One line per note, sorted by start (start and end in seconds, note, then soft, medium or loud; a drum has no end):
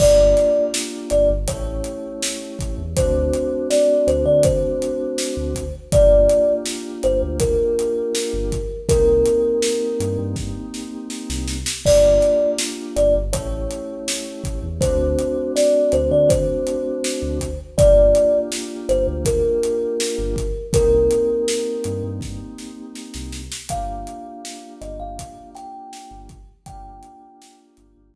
0.00 0.33 G1 loud
0.00 1.33 A#3 loud
0.00 1.33 D4 loud
0.00 1.33 F4 loud
0.00 1.33 G4 loud
0.00 0.64 D5 medium
0.00 kick loud
0.00 crash loud
0.37 snare soft
0.37 closed hi-hat medium
0.74 snare loud
1.10 1.28 G1 medium
1.10 1.28 D5 medium
1.10 closed hi-hat medium
1.30 1.46 G1 medium
1.48 1.81 A1 medium
1.48 2.82 A3 loud
1.48 2.82 C#4 loud
1.48 2.82 E4 loud
1.48 2.82 G4 loud
1.48 2.72 C#5 medium
1.48 kick medium
1.48 closed hi-hat loud
1.84 closed hi-hat medium
2.23 snare loud
2.59 2.76 A1 medium
2.59 kick medium
2.59 closed hi-hat medium
2.78 2.94 E2 medium
2.96 3.30 D2 medium
2.96 5.63 A3 loud
2.96 5.63 C4 loud
2.96 5.63 D4 loud
2.96 5.63 F#4 loud
2.96 3.67 C5 medium
2.96 kick loud
2.96 closed hi-hat loud
3.33 closed hi-hat medium
3.70 4.06 D5 medium
3.70 snare loud
4.07 4.24 D2 medium
4.07 4.25 C5 medium
4.07 closed hi-hat medium
4.26 4.59 D3 medium
4.26 4.43 D5 medium
4.43 5.74 C5 medium
4.43 kick loud
4.43 closed hi-hat loud
4.82 closed hi-hat medium
5.18 snare loud
5.37 5.70 D2 medium
5.55 kick medium
5.55 closed hi-hat medium
5.92 6.26 G1 loud
5.92 8.59 A#3 loud
5.92 8.59 D4 loud
5.92 8.59 F4 loud
5.92 8.59 G4 loud
5.92 6.53 D5 medium
5.92 kick loud
5.92 closed hi-hat loud
6.29 closed hi-hat medium
6.66 snare loud
7.03 7.20 G1 medium
7.03 7.21 C5 medium
7.03 closed hi-hat medium
7.22 7.56 D2 medium
7.40 8.79 A#4 medium
7.40 kick medium
7.40 closed hi-hat loud
7.79 closed hi-hat medium
8.15 snare loud
8.33 8.67 G1 medium
8.52 kick medium
8.52 closed hi-hat medium
8.89 9.22 C2 medium
8.89 11.56 A#3 loud
8.89 11.56 C4 loud
8.89 11.56 D#4 loud
8.89 11.56 G4 loud
8.89 10.17 A#4 medium
8.89 kick loud
8.89 closed hi-hat loud
9.26 closed hi-hat medium
9.62 snare loud
10.00 10.17 G2 medium
10.00 closed hi-hat medium
10.19 10.52 G2 medium
10.36 kick medium
10.36 snare medium
10.74 snare medium
11.10 snare medium
11.30 11.63 C2 medium
11.30 snare medium
11.48 snare medium
11.66 snare loud
11.85 12.19 G1 loud
11.85 13.19 A#3 loud
11.85 13.19 D4 loud
11.85 13.19 F4 loud
11.85 13.19 G4 loud
11.85 12.50 D5 medium
11.85 kick loud
11.85 crash loud
12.21 snare soft
12.21 closed hi-hat medium
12.58 snare loud
12.96 13.13 G1 medium
12.96 13.14 D5 medium
12.96 closed hi-hat medium
13.15 13.31 G1 medium
13.33 13.67 A1 medium
13.33 14.67 A3 loud
13.33 14.67 C#4 loud
13.33 14.67 E4 loud
13.33 14.67 G4 loud
13.33 14.57 C#5 medium
13.33 kick medium
13.33 closed hi-hat loud
13.71 closed hi-hat medium
14.08 snare loud
14.44 14.61 A1 medium
14.44 kick medium
14.44 closed hi-hat medium
14.63 14.80 E2 medium
14.81 15.15 D2 medium
14.81 17.48 A3 loud
14.81 17.48 C4 loud
14.81 17.48 D4 loud
14.81 17.48 F#4 loud
14.81 15.52 C5 medium
14.81 kick loud
14.81 closed hi-hat loud
15.19 closed hi-hat medium
15.56 15.92 D5 medium
15.56 snare loud
15.92 16.09 D2 medium
15.92 16.10 C5 medium
15.92 closed hi-hat medium
16.11 16.44 D3 medium
16.11 16.29 D5 medium
16.29 17.58 C5 medium
16.29 kick loud
16.29 closed hi-hat loud
16.67 closed hi-hat medium
17.04 snare loud
17.22 17.56 D2 medium
17.40 kick medium
17.40 closed hi-hat medium
17.78 18.11 G1 loud
17.78 20.45 A#3 loud
17.78 20.45 D4 loud
17.78 20.45 F4 loud
17.78 20.45 G4 loud
17.78 18.38 D5 medium
17.78 kick loud
17.78 closed hi-hat loud
18.15 closed hi-hat medium
18.52 snare loud
18.89 19.06 G1 medium
18.89 19.07 C5 medium
18.89 closed hi-hat medium
19.07 19.41 D2 medium
19.25 20.65 A#4 medium
19.25 kick medium
19.25 closed hi-hat loud
19.63 closed hi-hat medium
20.00 snare loud
20.19 20.52 G1 medium
20.36 kick medium
20.36 closed hi-hat medium
20.73 21.07 C2 medium
20.73 23.41 A#3 loud
20.73 23.41 C4 loud
20.73 23.41 D#4 loud
20.73 23.41 G4 loud
20.73 22.03 A#4 medium
20.73 kick loud
20.73 closed hi-hat loud
21.11 closed hi-hat medium
21.48 snare loud
21.84 22.02 G2 medium
21.84 closed hi-hat medium
22.04 22.37 G2 medium
22.21 kick medium
22.21 snare medium
22.58 snare medium
22.95 snare medium
23.14 23.48 C2 medium
23.14 snare medium
23.32 snare medium
23.52 snare loud
23.69 24.04 G1 medium
23.69 26.37 A#3 loud
23.69 26.37 D4 loud
23.69 26.37 F4 medium
23.69 26.37 G4 loud
23.69 24.74 F5 medium
23.69 kick medium
23.69 closed hi-hat loud
24.07 closed hi-hat medium
24.45 snare loud
24.81 24.98 G1 medium
24.81 24.99 D#5 medium
24.81 snare soft
24.81 closed hi-hat medium
25.00 25.33 G1 medium
25.00 25.50 F5 medium
25.19 kick medium
25.19 closed hi-hat loud
25.55 26.19 G5 medium
25.55 snare soft
25.55 closed hi-hat medium
25.93 snare loud
26.11 26.44 G1 medium
26.29 kick medium
26.29 closed hi-hat medium
26.66 27.00 G1 medium
26.66 28.15 A#3 loud
26.66 28.15 D4 loud
26.66 28.15 F4 loud
26.66 28.15 G4 loud
26.66 27.56 G5 medium
26.66 kick loud
26.66 closed hi-hat loud
27.03 closed hi-hat medium
27.42 snare loud
27.77 27.94 G1 medium
27.77 closed hi-hat medium
27.96 28.15 G1 medium
28.14 kick medium